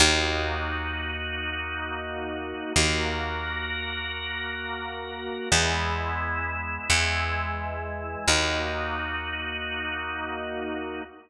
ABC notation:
X:1
M:4/4
L:1/8
Q:1/4=87
K:D#phr
V:1 name="Drawbar Organ"
[A,DF]8 | [A,FA]8 | [G,B,E]4 [E,G,E]4 | [A,DF]8 |]
V:2 name="Electric Bass (finger)" clef=bass
D,,8 | D,,8 | E,,4 E,,4 | D,,8 |]